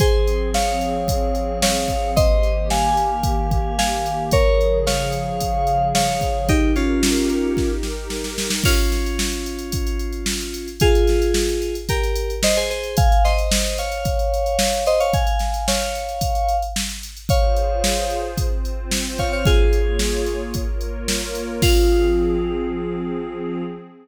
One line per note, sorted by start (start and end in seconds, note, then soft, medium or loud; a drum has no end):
0.00 2.14 F3 medium
0.00 2.14 C4 medium
0.00 0.49 G#4 medium
0.00 2.14 G#4 medium
0.00 0.49 C5 loud
0.00 kick loud
0.00 closed hi-hat loud
0.27 closed hi-hat medium
0.54 1.58 C#5 medium
0.54 1.58 F5 medium
0.54 snare medium
0.81 closed hi-hat medium
1.08 kick medium
1.08 closed hi-hat loud
1.35 closed hi-hat medium
1.62 2.11 C#5 medium
1.62 2.11 F5 medium
1.62 snare loud
1.88 kick medium
1.88 closed hi-hat medium
2.16 4.30 D#3 medium
2.16 4.30 A#3 medium
2.16 4.30 G4 medium
2.16 2.68 C5 loud
2.16 2.68 D#5 loud
2.16 kick loud
2.16 closed hi-hat loud
2.43 closed hi-hat medium
2.70 3.75 F5 medium
2.70 3.75 G#5 medium
2.70 snare medium
2.97 closed hi-hat medium
3.23 kick medium
3.23 closed hi-hat loud
3.51 kick medium
3.51 closed hi-hat medium
3.78 4.23 F5 medium
3.78 4.23 G#5 loud
3.78 snare loud
4.06 closed hi-hat medium
4.31 6.47 C#3 medium
4.31 6.47 F3 medium
4.31 6.47 G#4 medium
4.31 4.79 A#4 medium
4.31 4.79 C#5 loud
4.31 kick loud
4.31 closed hi-hat loud
4.61 closed hi-hat medium
4.86 5.87 C#5 medium
4.86 5.87 F5 loud
4.86 snare loud
5.12 closed hi-hat medium
5.40 kick medium
5.40 closed hi-hat loud
5.67 closed hi-hat medium
5.95 6.47 C#5 medium
5.95 6.47 F5 medium
5.95 snare loud
6.21 kick medium
6.21 closed hi-hat medium
6.48 8.62 D#4 medium
6.48 6.72 D#4 loud
6.48 8.62 G4 medium
6.48 6.72 G4 loud
6.48 8.62 A#4 medium
6.48 kick loud
6.48 closed hi-hat loud
6.76 7.69 C#4 medium
6.76 7.69 F4 medium
6.76 closed hi-hat medium
7.03 snare loud
7.29 closed hi-hat medium
7.57 kick medium
7.57 snare medium
7.83 snare medium
8.10 snare medium
8.24 snare medium
8.38 snare loud
8.50 snare loud
8.64 10.68 C#4 medium
8.64 10.68 F4 loud
8.64 kick loud
8.64 crash loud
8.77 closed hi-hat medium
8.92 snare medium
8.92 closed hi-hat medium
9.06 closed hi-hat medium
9.19 snare loud
9.32 closed hi-hat medium
9.46 closed hi-hat medium
9.59 closed hi-hat medium
9.72 kick medium
9.72 closed hi-hat loud
9.87 closed hi-hat medium
9.99 closed hi-hat medium
10.13 closed hi-hat medium
10.26 snare loud
10.41 closed hi-hat medium
10.54 closed hi-hat medium
10.68 closed hi-hat medium
10.80 11.75 F4 medium
10.80 11.75 G#4 loud
10.80 kick loud
10.80 closed hi-hat loud
10.95 closed hi-hat medium
11.07 snare medium
11.07 closed hi-hat medium
11.22 closed hi-hat medium
11.34 snare loud
11.49 closed hi-hat medium
11.62 closed hi-hat medium
11.75 closed hi-hat medium
11.89 12.34 G4 medium
11.89 12.34 A#4 loud
11.89 kick medium
11.89 closed hi-hat loud
12.03 closed hi-hat medium
12.16 closed hi-hat medium
12.30 closed hi-hat medium
12.43 12.56 C5 medium
12.43 12.56 D#5 medium
12.43 snare loud
12.57 12.70 G#4 medium
12.57 12.70 C5 medium
12.57 closed hi-hat medium
12.70 12.96 G#4 medium
12.70 12.96 C5 medium
12.70 closed hi-hat medium
12.83 closed hi-hat medium
12.97 13.23 F5 loud
12.97 13.23 G#5 loud
12.97 kick loud
12.97 closed hi-hat loud
13.12 closed hi-hat medium
13.24 13.77 C5 medium
13.24 13.77 D#5 loud
13.24 snare soft
13.24 closed hi-hat medium
13.38 closed hi-hat medium
13.51 snare loud
13.66 closed hi-hat medium
13.78 14.84 C#5 medium
13.78 14.84 F5 medium
13.78 closed hi-hat medium
13.92 closed hi-hat medium
14.05 kick medium
14.05 closed hi-hat medium
14.19 closed hi-hat medium
14.34 closed hi-hat medium
14.46 closed hi-hat medium
14.59 snare loud
14.73 closed hi-hat medium
14.86 14.99 C5 medium
14.86 14.99 D#5 medium
14.86 closed hi-hat medium
15.00 15.13 C#5 medium
15.00 15.13 F5 loud
15.00 closed hi-hat medium
15.14 15.66 F5 medium
15.14 15.66 G#5 loud
15.14 kick loud
15.14 closed hi-hat medium
15.27 closed hi-hat medium
15.39 snare medium
15.39 closed hi-hat medium
15.54 closed hi-hat medium
15.68 16.56 C#5 medium
15.68 16.56 F5 loud
15.68 snare loud
15.80 closed hi-hat medium
15.95 closed hi-hat medium
16.09 closed hi-hat medium
16.21 kick medium
16.21 closed hi-hat loud
16.35 closed hi-hat medium
16.49 closed hi-hat medium
16.62 closed hi-hat medium
16.76 snare loud
16.90 closed hi-hat medium
17.03 closed hi-hat medium
17.17 closed hi-hat medium
17.29 18.37 F4 medium
17.29 18.37 G#4 medium
17.29 18.37 C5 medium
17.29 18.19 C#5 medium
17.29 18.19 F5 loud
17.29 kick loud
17.29 closed hi-hat loud
17.56 closed hi-hat medium
17.84 snare loud
18.10 closed hi-hat medium
18.38 19.45 C4 medium
18.38 19.45 F4 medium
18.38 19.45 C5 medium
18.38 kick medium
18.38 closed hi-hat loud
18.65 closed hi-hat medium
18.91 snare loud
19.18 19.32 C#5 medium
19.18 19.32 F5 medium
19.18 kick medium
19.18 closed hi-hat medium
19.32 19.45 C#5 medium
19.32 19.45 F5 medium
19.45 20.53 A#3 medium
19.45 20.43 F4 medium
19.45 20.53 F4 medium
19.45 20.43 G#4 loud
19.45 20.53 G#4 medium
19.45 20.53 C#5 medium
19.45 kick loud
19.45 closed hi-hat medium
19.73 closed hi-hat medium
19.99 snare loud
20.26 closed hi-hat medium
20.54 21.61 A#3 medium
20.54 21.61 F4 medium
20.54 21.61 A#4 medium
20.54 21.61 C#5 medium
20.54 kick medium
20.54 closed hi-hat medium
20.81 closed hi-hat medium
21.08 snare loud
21.35 closed hi-hat medium
21.62 23.63 F3 loud
21.62 23.63 C4 medium
21.62 23.63 F4 loud
21.62 23.63 G#4 loud
21.62 kick loud
21.62 crash loud